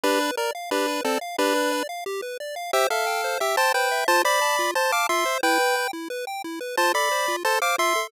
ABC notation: X:1
M:4/4
L:1/8
Q:1/4=178
K:C
V:1 name="Lead 1 (square)"
[DB]2 ^A z [DB]2 [C=A] z | [DB]3 z5 | [Ge] [Af]3 [Ge] [ca] [Bg]2 | [ca] [db]3 [ca] [fd'] [ec']2 |
[Bg]3 z5 | [ca] [db]3 [ca] [fd'] [ec']2 |]
V:2 name="Lead 1 (square)"
G B d f G B d f | G B d f G B d f | c e g c e g c e | F c a F c a F c |
E B g E B g E B | F A c F A c F A |]